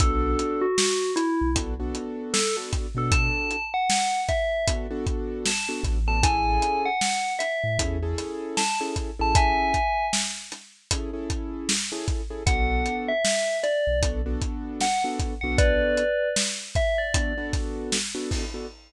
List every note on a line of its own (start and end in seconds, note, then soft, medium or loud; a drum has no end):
0.00 0.35 B1 medium
0.00 0.66 B3 loud
0.00 0.66 D4 loud
0.00 0.66 F#4 loud
0.00 0.66 A4 medium
0.00 0.60 A4 medium
0.00 kick loud
0.00 closed hi-hat loud
0.39 closed hi-hat medium
0.62 1.11 F#4 medium
0.78 snare loud
1.16 1.49 E4 loud
1.16 closed hi-hat medium
1.41 1.54 B1 medium
1.55 1.91 B1 medium
1.55 1.74 B3 loud
1.55 1.74 D4 medium
1.55 1.74 F#4 medium
1.55 1.74 A4 medium
1.55 kick medium
1.55 closed hi-hat loud
1.80 2.39 B3 medium
1.80 2.39 D4 medium
1.80 2.39 F#4 medium
1.80 2.39 A4 medium
1.95 closed hi-hat medium
2.34 2.56 A4 medium
2.34 snare loud
2.57 2.87 B3 medium
2.57 2.87 D4 medium
2.57 2.87 F#4 medium
2.57 2.87 A4 medium
2.73 kick loud
2.73 closed hi-hat medium
2.95 3.29 B2 medium
2.95 3.56 B3 medium
2.95 3.56 D4 medium
2.95 3.56 F#4 medium
2.95 3.56 A4 loud
2.95 3.13 A4 medium
3.12 3.63 A5 loud
3.12 kick loud
3.12 closed hi-hat loud
3.51 closed hi-hat medium
3.74 4.20 F#5 medium
3.90 snare loud
4.29 4.66 E5 medium
4.29 kick medium
4.29 closed hi-hat medium
4.68 4.87 B3 medium
4.68 4.87 D4 medium
4.68 4.87 F#4 medium
4.68 4.87 A4 medium
4.68 kick loud
4.68 closed hi-hat loud
4.90 5.50 B3 medium
4.90 5.50 D4 loud
4.90 5.50 F#4 loud
4.90 5.50 A4 medium
5.06 kick loud
5.06 closed hi-hat medium
5.45 5.69 A5 medium
5.45 snare loud
5.69 5.98 B3 medium
5.69 5.98 D4 medium
5.69 5.98 F#4 medium
5.69 5.98 A4 medium
5.83 6.58 A1 loud
5.83 kick medium
5.83 closed hi-hat medium
6.07 6.20 B3 medium
6.07 6.20 D4 medium
6.07 6.20 F#4 medium
6.07 6.20 A4 medium
6.07 6.23 A5 medium
6.23 6.88 C#4 loud
6.23 6.88 E4 loud
6.23 6.88 G#4 loud
6.23 6.88 A4 loud
6.23 6.82 G#5 loud
6.23 kick loud
6.23 closed hi-hat loud
6.62 closed hi-hat medium
6.86 7.33 F#5 medium
7.01 snare loud
7.39 7.77 E5 medium
7.39 closed hi-hat medium
7.63 7.78 A2 medium
7.78 8.14 E2 medium
7.78 7.98 C#4 medium
7.78 7.98 E4 medium
7.78 7.98 G#4 medium
7.78 7.98 A4 medium
7.78 kick medium
7.78 closed hi-hat loud
8.02 8.62 C#4 medium
8.02 8.62 E4 medium
8.02 8.62 G#4 loud
8.02 8.62 A4 loud
8.18 snare soft
8.18 closed hi-hat medium
8.57 8.79 A5 medium
8.57 snare loud
8.81 9.10 C#4 medium
8.81 9.10 E4 medium
8.81 9.10 G#4 medium
8.81 9.10 A4 medium
8.96 kick medium
8.96 closed hi-hat medium
9.19 9.54 A1 medium
9.19 9.79 C#4 medium
9.19 9.79 E4 medium
9.19 9.79 G#4 medium
9.19 9.79 A4 medium
9.19 9.36 A5 medium
9.35 10.06 E5 medium
9.35 10.06 G#5 loud
9.35 kick loud
9.35 closed hi-hat loud
9.74 kick medium
9.74 closed hi-hat medium
10.13 snare loud
10.52 snare soft
10.52 closed hi-hat medium
10.91 11.11 C#4 medium
10.91 11.11 E4 medium
10.91 11.11 G#4 medium
10.91 11.11 A4 medium
10.91 kick medium
10.91 closed hi-hat loud
11.13 11.73 C#4 medium
11.13 11.73 E4 medium
11.13 11.73 G#4 medium
11.13 11.73 A4 medium
11.30 kick medium
11.30 closed hi-hat medium
11.69 snare loud
11.92 12.22 C#4 medium
11.92 12.22 E4 medium
11.92 12.22 G#4 loud
11.92 12.22 A4 medium
12.08 kick loud
12.08 closed hi-hat medium
12.30 12.43 C#4 medium
12.30 12.43 E4 medium
12.30 12.43 G#4 loud
12.30 12.43 A4 medium
12.46 12.82 B1 loud
12.46 13.12 B3 medium
12.46 13.12 D4 loud
12.46 13.12 F#4 medium
12.46 13.12 A4 loud
12.46 12.96 F#5 medium
12.46 kick loud
12.46 closed hi-hat loud
12.86 closed hi-hat medium
13.08 13.57 E5 loud
13.25 snare loud
13.63 13.99 D5 medium
13.63 closed hi-hat medium
13.87 14.01 B1 medium
14.01 14.37 B1 medium
14.01 14.21 B3 medium
14.01 14.21 D4 medium
14.01 14.21 F#4 medium
14.01 14.21 A4 medium
14.01 kick loud
14.01 closed hi-hat loud
14.26 14.85 B3 medium
14.26 14.85 D4 loud
14.26 14.85 F#4 medium
14.26 14.85 A4 medium
14.42 kick medium
14.42 closed hi-hat medium
14.81 15.03 F#5 medium
14.81 snare loud
15.04 15.34 B3 medium
15.04 15.34 D4 medium
15.04 15.34 F#4 medium
15.04 15.34 A4 medium
15.19 kick medium
15.19 closed hi-hat medium
15.41 15.77 B1 medium
15.41 16.03 B3 medium
15.41 16.03 D4 medium
15.41 16.03 F#4 loud
15.41 16.03 A4 medium
15.41 15.56 F#5 medium
15.58 16.29 B4 medium
15.58 16.29 D5 loud
15.58 kick loud
15.58 closed hi-hat loud
15.97 closed hi-hat medium
16.36 snare loud
16.75 16.98 E5 medium
16.75 kick loud
16.75 closed hi-hat medium
16.98 17.45 D5 medium
17.14 17.33 B3 medium
17.14 17.33 D4 medium
17.14 17.33 F#4 medium
17.14 17.33 A4 medium
17.14 kick loud
17.14 closed hi-hat loud
17.38 17.97 B3 loud
17.38 17.97 D4 medium
17.38 17.97 F#4 loud
17.38 17.97 A4 medium
17.53 kick loud
17.53 snare soft
17.53 closed hi-hat medium
17.92 snare loud
18.15 18.44 B3 loud
18.15 18.44 D4 medium
18.15 18.44 F#4 medium
18.15 18.44 A4 medium
18.31 kick medium
18.31 open hi-hat medium
18.54 18.67 B3 medium
18.54 18.67 D4 medium
18.54 18.67 F#4 medium
18.54 18.67 A4 medium